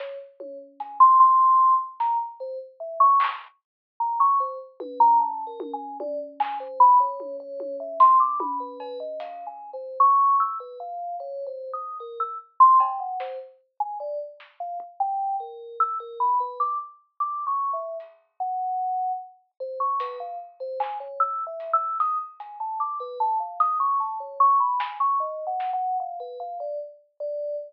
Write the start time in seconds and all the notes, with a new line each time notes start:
0.00 C#5, snare
0.40 C#5, high tom
0.80 G#5, closed hi-hat
1.00 C6
1.20 C6
1.60 kick
2.00 A#5, snare
2.40 C5
2.80 E5
3.00 C#6
3.20 clap
4.00 A#5
4.20 C#6
4.40 C5
4.80 B4, high tom
5.00 A#5
5.20 A5
5.47 A#4
5.60 high tom
5.74 G#5
6.00 D5, high tom
6.40 G#5, clap
6.60 C5
6.80 B5
7.00 C#5
7.20 high tom
7.40 C#5
7.60 high tom
7.80 E5
8.00 C6, closed hi-hat
8.20 D6
8.40 B5, high tom
8.60 B4
8.80 B4, cowbell
9.00 D#5
9.20 F5, closed hi-hat
9.47 G#5
9.73 C5
10.00 C#6
10.40 E6
10.60 B4
10.80 F5
11.20 C#5
11.46 C5
11.74 D#6
12.00 A#4
12.20 E6
12.60 C6
12.80 G5, cowbell
13.00 F#5
13.20 C5, snare
13.80 G#5
14.00 D5
14.40 snare
14.60 F5
14.80 kick
15.00 G5
15.40 A#4
15.80 E6
16.00 A#4
16.20 B5
16.40 B4
16.60 D6
17.20 D6
17.47 C#6
17.73 E5
18.00 closed hi-hat
18.40 F#5
19.60 C5
19.80 C#6
20.00 B4, closed hi-hat
20.20 F5
20.60 C5
20.80 G#5, clap
21.00 C#5
21.20 E6
21.47 E5
21.60 closed hi-hat
21.73 E6
22.00 D#6, closed hi-hat
22.40 G#5, closed hi-hat
22.60 A5
22.80 D6
23.00 B4
23.20 A5
23.40 F5
23.60 D#6, closed hi-hat
23.80 C#6
24.00 A5
24.20 C#5
24.40 C#6
24.60 B5
24.80 G#5, snare
25.00 C#6
25.20 D#5
25.47 F#5
25.60 snare
25.73 F#5
26.00 F5
26.20 B4
26.40 F5
26.60 D5
27.20 D5